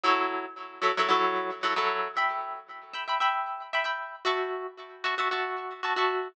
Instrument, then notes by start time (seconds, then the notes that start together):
acoustic guitar (steel)
0.04 F#3 E4 A4 C#5
0.82 F#3 E4 A4 C#5
0.97 F#3 E4 A4 C#5
1.09 F#3 E4 A4 C#5
1.63 F#3 E4 A4 C#5
1.76 F#3 E4 A4 C#5
2.17 E5 G5 B5
2.94 E5 G5 B5
3.08 E5 G5 B5
3.20 E5 G5 B5
3.73 E5 G5 B5
3.84 E5 G5 B5
4.25 F#4 E5 A5 C#6
5.04 F#4 E5 A5 C#6
5.18 F#4 E5 A5 C#6
5.31 F#4 E5 A5 C#6
5.83 F#4 E5 A5 C#6
5.96 F#4 E5 A5 C#6